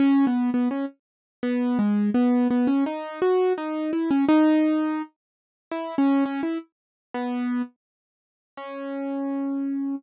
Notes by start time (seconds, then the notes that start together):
0.00 C#4
0.27 B3
0.54 B3
0.71 C#4
1.43 B3
1.79 G#3
2.14 B3
2.51 B3
2.67 C#4
2.86 D#4
3.22 F#4
3.58 D#4
3.93 E4
4.11 C#4
4.28 D#4
5.71 E4
5.98 C#4
6.25 C#4
6.43 E4
7.14 B3
8.57 C#4